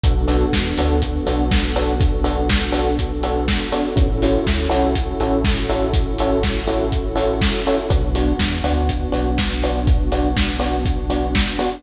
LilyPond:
<<
  \new Staff \with { instrumentName = "Electric Piano 1" } { \time 4/4 \key b \minor \tempo 4 = 122 <b d' fis' a'>8 <b d' fis' a'>4 <b d' fis' a'>4 <b d' fis' a'>4 <b d' fis' a'>8~ | <b d' fis' a'>8 <b d' fis' a'>4 <b d' fis' a'>4 <b d' fis' a'>4 <b d' fis' a'>8 | <cis' e' fis' a'>8 <cis' e' fis' a'>4 <cis' e' fis' a'>4 <cis' e' fis' a'>4 <cis' e' fis' a'>8~ | <cis' e' fis' a'>8 <cis' e' fis' a'>4 <cis' e' fis' a'>4 <cis' e' fis' a'>4 <cis' e' fis' a'>8 |
<b d' fis'>8 <b d' fis'>4 <b d' fis'>4 <b d' fis'>4 <b d' fis'>8~ | <b d' fis'>8 <b d' fis'>4 <b d' fis'>4 <b d' fis'>4 <b d' fis'>8 | }
  \new Staff \with { instrumentName = "Synth Bass 2" } { \clef bass \time 4/4 \key b \minor b,,4 e,8 d,4 b,,4.~ | b,,1 | a,,4 d,8 c,4 a,,4.~ | a,,1 |
b,,4 e,8 d,4 b,,4.~ | b,,1 | }
  \new Staff \with { instrumentName = "Pad 2 (warm)" } { \time 4/4 \key b \minor <b d' fis' a'>1~ | <b d' fis' a'>1 | <cis' e' fis' a'>1~ | <cis' e' fis' a'>1 |
<b d' fis'>1~ | <b d' fis'>1 | }
  \new DrumStaff \with { instrumentName = "Drums" } \drummode { \time 4/4 <hh bd>8 hho8 <bd sn>8 hho8 <hh bd>8 hho8 <bd sn>8 hho8 | <hh bd>8 hho8 <bd sn>8 hho8 <hh bd>8 hho8 <bd sn>8 hho8 | <hh bd>8 hho8 <bd sn>8 hho8 <hh bd>8 hho8 <bd sn>8 hho8 | <hh bd>8 hho8 <bd sn>8 hho8 <hh bd>8 hho8 <bd sn>8 hho8 |
<hh bd>8 hho8 <bd sn>8 hho8 <hh bd>8 hho8 <bd sn>8 hho8 | <hh bd>8 hho8 <bd sn>8 hho8 <hh bd>8 hho8 <bd sn>8 hho8 | }
>>